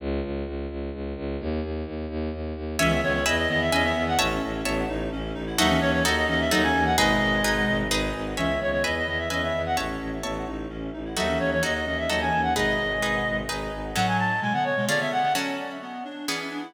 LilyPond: <<
  \new Staff \with { instrumentName = "Clarinet" } { \time 3/4 \key cis \minor \tempo 4 = 129 r2. | r2. | e''8 cis''16 cis''16 dis''16 dis''16 dis''16 e''16 dis''16 e''8 fis''16 | r2. |
e''8 cis''16 cis''16 dis''16 dis''16 dis''16 e''16 dis''16 gis''8 fis''16 | dis''2 r4 | e''8 cis''16 cis''16 dis''16 dis''16 dis''16 e''16 dis''16 e''8 fis''16 | r2. |
e''8 cis''16 cis''16 dis''16 dis''16 dis''16 e''16 dis''16 gis''8 fis''16 | dis''2 r4 | \key fis \minor fis''16 gis''16 a''8 gis''16 fis''16 cis''8 d''16 e''16 fis''8 | r2. | }
  \new Staff \with { instrumentName = "Clarinet" } { \time 3/4 \key cis \minor r2. | r2. | <e cis'>16 <dis b>16 <dis b>16 <dis b>16 r8 <dis b>8 <e cis'>16 <dis b>8. | cis'4 b8 dis'8 cis'8 dis'16 e'16 |
<fis dis'>16 <e cis'>16 <e cis'>16 <e cis'>16 r8 <e cis'>8 <fis dis'>16 <e cis'>8. | <b, gis>2 r4 | <e cis'>16 <dis b>16 <dis b>16 <dis b>16 r8 <dis b>8 <e cis'>16 <dis b>8. | cis'4 b8 dis'8 cis'8 dis'16 e'16 |
<fis dis'>16 <e cis'>16 <e cis'>16 <e cis'>16 r8 <e cis'>8 <fis dis'>16 <e cis'>8. | <b, gis>2 r4 | \key fis \minor <a, fis>4 <b, gis>16 <d b>8 <b, gis>16 <d b>16 <d b>8 <d b>16 | cis'4 b8 d'8 cis'8 d'16 e'16 | }
  \new Staff \with { instrumentName = "Orchestral Harp" } { \time 3/4 \key cis \minor r2. | r2. | <cis'' e'' gis''>4 <b' e'' gis''>4 <b' e'' gis''>4 | <cis'' e'' a''>4 <cis'' e'' a''>2 |
<dis' fis' a'>4 <dis' fis' a'>4 <dis' fis' a'>4 | <dis' gis' b'>4 <dis' gis' b'>4 <dis' gis' b'>4 | <cis'' e'' gis''>4 <b' e'' gis''>4 <b' e'' gis''>4 | <cis'' e'' a''>4 <cis'' e'' a''>2 |
<dis' fis' a'>4 <dis' fis' a'>4 <dis' fis' a'>4 | <dis' gis' b'>4 <dis' gis' b'>4 <dis' gis' b'>4 | \key fis \minor <fis cis' a'>2 <cis' eis' gis'>4 | <fis cis' a'>2 <e b gis'>4 | }
  \new Staff \with { instrumentName = "Violin" } { \clef bass \time 3/4 \key cis \minor cis,8 cis,8 cis,8 cis,8 cis,8 cis,8 | dis,8 dis,8 dis,8 dis,8 dis,8 dis,8 | cis,8 cis,8 e,8 e,8 e,8 e,8 | a,,8 a,,8 a,,8 a,,8 a,,8 a,,8 |
dis,8 dis,8 dis,8 dis,8 dis,8 dis,8 | gis,,8 gis,,8 gis,,8 gis,,8 gis,,8 gis,,8 | cis,8 cis,8 e,8 e,8 e,8 e,8 | a,,8 a,,8 a,,8 a,,8 a,,8 a,,8 |
dis,8 dis,8 dis,8 dis,8 dis,8 dis,8 | gis,,8 gis,,8 gis,,8 gis,,8 gis,,8 gis,,8 | \key fis \minor r2. | r2. | }
>>